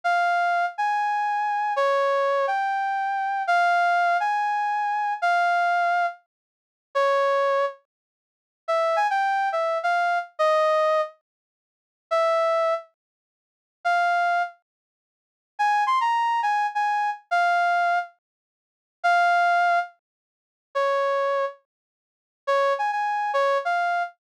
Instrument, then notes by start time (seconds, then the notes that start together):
brass section
0.04 F5
0.78 G#5
1.76 C#5
2.47 G5
3.47 F5
4.20 G#5
5.22 F5
6.95 C#5
8.68 E5
8.96 G#5
9.10 G5
9.52 E5
9.83 F5
10.39 D#5
12.11 E5
13.85 F5
15.59 G#5
15.87 C6
16.01 A#5
16.43 G#5
16.75 G#5
17.31 F5
19.04 F5
20.75 C#5
22.47 C#5
22.79 G#5
22.92 G#5
23.34 C#5
23.65 F5